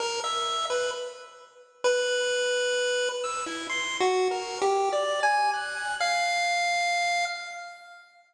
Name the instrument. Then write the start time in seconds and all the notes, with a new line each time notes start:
lead 1 (square)
0.00 A#4
0.24 E5
0.70 B4
1.84 B4
3.24 E6
3.46 E4
3.69 C6
4.00 F#4
4.31 A#4
4.62 G4
4.93 D5
5.23 G#5
5.53 F#6
6.00 F5